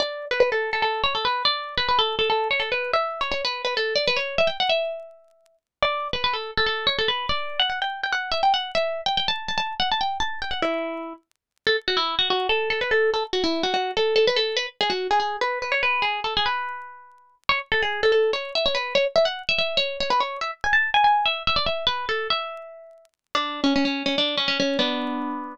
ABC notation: X:1
M:7/8
L:1/16
Q:1/4=144
K:D
V:1 name="Pizzicato Strings"
d3 B B A2 A A2 c A B2 | d3 B B A2 A A2 c A B2 | e3 c c B2 B A2 d B c2 | e g f e9 z2 |
d3 B B A2 A A2 c A B2 | d3 f f g2 g f2 e g f2 | e3 g g a2 a a2 f a g2 | a2 g f E6 z4 |
[K:A] A z F E2 F F2 A2 A B A2 | A z F E2 F F2 A2 A B A2 | B z G F2 G G2 B2 B c B2 | G2 A G B10 |
c z A G2 A A2 c2 e c B2 | c z e f2 e e2 c2 c B c2 | e z g a2 g g2 e2 e d e2 | B2 A2 e8 z2 |
[K:D] D3 C C C2 C D2 C C C2 | [B,D]8 z6 |]